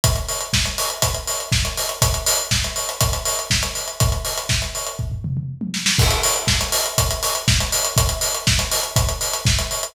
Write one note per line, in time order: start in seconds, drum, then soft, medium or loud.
0.04 kick medium
0.04 closed hi-hat medium
0.16 closed hi-hat medium
0.29 open hi-hat medium
0.40 closed hi-hat medium
0.53 kick medium
0.53 snare loud
0.65 closed hi-hat medium
0.78 open hi-hat medium
0.90 closed hi-hat medium
1.02 kick medium
1.02 closed hi-hat medium
1.14 closed hi-hat medium
1.27 open hi-hat medium
1.40 closed hi-hat medium
1.52 kick medium
1.52 snare medium
1.65 closed hi-hat medium
1.77 open hi-hat medium
1.89 closed hi-hat medium
2.02 kick medium
2.02 closed hi-hat loud
2.14 closed hi-hat medium
2.26 open hi-hat medium
2.39 closed hi-hat medium
2.51 kick medium
2.51 snare loud
2.64 closed hi-hat medium
2.76 open hi-hat medium
2.89 closed hi-hat medium
3.01 kick medium
3.01 closed hi-hat medium
3.13 closed hi-hat medium
3.25 open hi-hat medium
3.39 closed hi-hat medium
3.50 kick medium
3.50 snare loud
3.63 closed hi-hat medium
3.75 open hi-hat medium
3.88 closed hi-hat medium
4.00 kick medium
4.00 closed hi-hat medium
4.12 closed hi-hat medium
4.25 open hi-hat medium
4.38 closed hi-hat medium
4.49 kick medium
4.49 snare medium
4.62 closed hi-hat medium
4.75 open hi-hat medium
4.87 closed hi-hat medium
4.99 kick medium
5.12 floor tom medium
5.24 mid tom medium
5.37 mid tom medium
5.61 high tom medium
5.74 snare medium
5.86 snare loud
5.99 kick medium
5.99 crash loud
6.11 closed hi-hat medium
6.23 open hi-hat medium
6.36 closed hi-hat medium
6.47 kick medium
6.47 snare loud
6.61 closed hi-hat medium
6.72 open hi-hat medium
6.86 closed hi-hat medium
6.98 kick medium
6.98 closed hi-hat loud
7.11 closed hi-hat medium
7.23 open hi-hat medium
7.35 closed hi-hat medium
7.48 kick medium
7.48 snare loud
7.60 closed hi-hat medium
7.72 open hi-hat medium
7.85 closed hi-hat medium
7.97 kick medium
7.97 closed hi-hat medium
8.09 closed hi-hat medium
8.21 open hi-hat medium
8.35 closed hi-hat medium
8.47 kick medium
8.47 snare loud
8.59 closed hi-hat medium
8.71 open hi-hat medium
8.83 closed hi-hat medium
8.96 kick medium
8.96 closed hi-hat medium
9.09 closed hi-hat medium
9.21 open hi-hat medium
9.33 closed hi-hat medium
9.45 kick medium
9.45 snare medium
9.59 closed hi-hat medium
9.71 open hi-hat medium
9.83 closed hi-hat medium